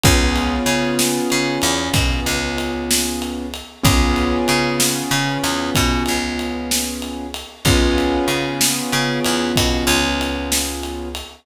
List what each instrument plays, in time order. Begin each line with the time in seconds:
0.03 electric bass (finger) C#2, acoustic grand piano B3 C#4 F4 G#4, kick, ride
0.36 ride
0.66 electric bass (finger) C#3, ride
0.99 snare
1.30 electric bass (finger) C#3, ride
1.62 electric bass (finger) E2, ride
1.94 electric bass (finger) B2, kick, ride
2.26 electric bass (finger) C#2, ride
2.58 ride
2.91 snare
3.22 ride
3.54 ride
3.83 electric bass (finger) C#2, acoustic grand piano B3 C#4 F4 G#4, kick, ride
4.16 ride
4.48 electric bass (finger) C#3, ride
4.80 snare
5.11 electric bass (finger) C#3, ride
5.44 electric bass (finger) E2, ride
5.75 electric bass (finger) B2, kick, ride
6.06 electric bass (finger) C#2, ride
6.39 ride
6.71 snare
7.02 ride
7.34 ride
7.65 electric bass (finger) C#2, acoustic grand piano B3 C#4 F4 G#4, kick, ride
7.98 ride
8.28 electric bass (finger) C#3, ride
8.61 snare
8.92 electric bass (finger) C#3, ride
9.24 electric bass (finger) E2, ride
9.56 electric bass (finger) B2, kick, ride
9.87 electric bass (finger) C#2, ride
10.21 ride
10.52 snare
10.83 ride
11.15 ride